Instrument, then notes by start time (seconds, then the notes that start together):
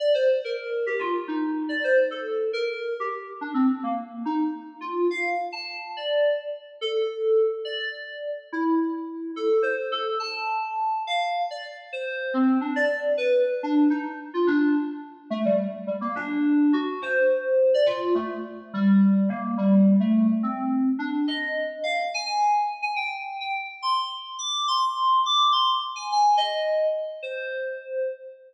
electric piano 2
0.00 D5
0.14 C5
0.45 A#4
0.86 G4
0.99 F4
1.28 D#4
1.69 D5
1.84 C5
2.11 A4
2.53 A#4
3.00 G4
3.41 D4
3.54 C4
3.83 A#3
4.25 D#4
4.81 F4
5.11 F5
5.52 A5
5.97 D5
6.81 A4
7.65 D5
7.79 D5
8.52 E4
9.36 A4
9.62 C5
9.92 A4
10.20 A5
11.07 F5
11.51 D5
11.93 C5
12.34 C4
12.61 D4
12.76 D5
13.17 B4
13.63 D4
13.90 D#4
14.34 F4
14.47 D4
15.30 A3
15.45 G3
15.87 G3
16.01 A#3
16.15 D4
16.73 F#4
17.02 C5
17.74 D5
17.86 F4
18.15 A3
18.74 G3
19.29 A#3
19.58 G3
20.00 A3
20.43 C4
20.99 D4
21.28 D#5
21.84 F5
22.14 G#5
22.26 G#5
22.82 G#5
22.96 G5
23.40 G5
23.82 C6
24.39 D6
24.68 C6
25.26 D6
25.52 C6
25.96 G#5
26.12 G#5
26.37 D#5
27.23 C5